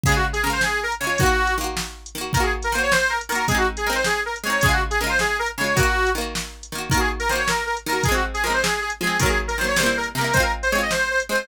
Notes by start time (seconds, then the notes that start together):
0.03 C#3 G#4, kick, closed hi-hat
0.09 G#3 F4
0.16 F#4
0.33 G#4, closed hi-hat
0.43 C#3 G#3 A#4
0.50 F4 C5
0.61 G#4, snare
0.83 A#4
0.92 closed hi-hat
1.00 C#3 G#3 C#5
1.07 F4
1.18 D#3 F#4, kick, closed hi-hat
1.23 A#3 F#4
1.47 closed hi-hat
1.58 D#3 A#3
1.64 F#4
1.77 snare
2.06 closed hi-hat
2.15 D#3 A#3
2.21 F#4
2.33 D#3 A#4, kick, closed hi-hat
2.37 A#3 F#4
2.43 G#4
2.62 A#4, closed hi-hat
2.72 D#3 A#3 C5
2.78 F#4
2.83 C#5
2.92 C5, snare
3.10 A#4
3.21 closed hi-hat
3.29 D#3 A#3 A#4
3.35 F#4
3.48 G#3 C4 G#4, kick, closed hi-hat
3.55 D#4 F#4
3.77 G#4, closed hi-hat
3.86 G#3 C4 A#4
3.93 D#4 C5
4.04 G#4, snare
4.26 A#4
4.36 closed hi-hat
4.43 G#3 C4 C#5
4.50 D#4
4.61 C#3 G#4, kick, closed hi-hat
4.66 G#3 F4
4.72 F#4
4.90 G#4, closed hi-hat
5.00 C#3 G#3 A#4
5.07 F4 C5
5.19 G#4, snare
5.39 A#4
5.46 closed hi-hat
5.58 C#3 G#3 C#5
5.64 F4
5.75 D#3 F#4, kick, closed hi-hat
5.80 A#3 F#4
6.07 closed hi-hat
6.15 D#3 A#3
6.21 F#4
6.35 snare
6.63 closed hi-hat
6.72 D#3 A#3
6.78 F#4
6.90 D#3 A#4, kick, closed hi-hat
6.94 A#3 F#4
7.00 G#4
7.20 A#4, closed hi-hat
7.29 D#3 A#3 C5
7.36 F#4 C#5
7.48 A#4, snare
7.66 A#4
7.77 closed hi-hat
7.86 D#3 A#3 A#4
7.93 F#4
8.03 F3 G#4, kick, closed hi-hat
8.08 G#3 C4
8.14 F#4
8.34 G#4, closed hi-hat
8.44 F3 G#3 A#4
8.50 C4 C5
8.62 G#4, snare
8.81 G#4
8.90 closed hi-hat
9.01 F3 G#3 G#4
9.07 C4
9.19 D#3 F#3 A#4, kick, closed hi-hat
9.26 A#3 G#4
9.48 A#4, closed hi-hat
9.58 D#3 F#3 C5
9.64 A#3 C#5
9.76 C3 G3 C5, snare
9.83 A#3 E4
9.97 A#4
10.03 closed hi-hat
10.15 C3 G3 A#4
10.21 A#3 E4
10.33 G#3 C4 C5, kick, closed hi-hat
10.40 F4 A#4
10.63 C5, closed hi-hat
10.72 G#3 C4 C#5
10.79 F4 D#5
10.91 C5, snare
11.11 C5
11.20 closed hi-hat
11.29 G#3 C4 C5
11.35 F4